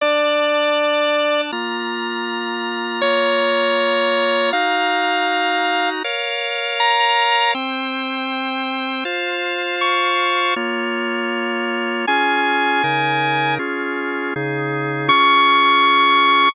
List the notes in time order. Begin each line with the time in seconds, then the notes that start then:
0.01 D4 D5 A5
1.52 A#3 F4 A#5
3.01 A#3 F4 C#5 A#5
4.53 D#4 F#4 F5 A#5
6.04 A#4 C#5 F5
6.80 A#5
7.55 C4 C5 G5
9.05 F4 C5 F5
9.81 C#6
10.56 A#3 F4 C#5
12.07 C#4 F4 G#4 G#5
12.84 C#3 D#4 A#4
13.59 C#4 F4 G#4
14.36 C#3 D#4 G#4
15.08 C#4 F4 G#4 C#6